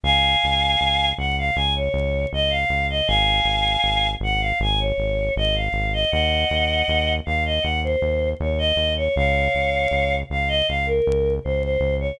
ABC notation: X:1
M:4/4
L:1/16
Q:1/4=79
K:Bbm
V:1 name="Choir Aahs"
[fa]6 g f a d3 e f2 e | [fa]6 g f a d3 e f2 e | [eg]6 f e g c3 d e2 d | [df]6 f e f B3 c c2 d |]
V:2 name="Synth Bass 1" clef=bass
D,,2 D,,2 D,,2 D,,2 D,,2 D,,2 D,,2 D,,2 | A,,,2 A,,,2 A,,,2 A,,,2 A,,,2 A,,,2 A,,,2 A,,,2 | E,,2 E,,2 E,,2 E,,2 E,,2 E,,2 E,,2 E,,2 | D,,2 D,,2 D,,2 D,,2 D,,2 D,,2 D,,2 D,,2 |]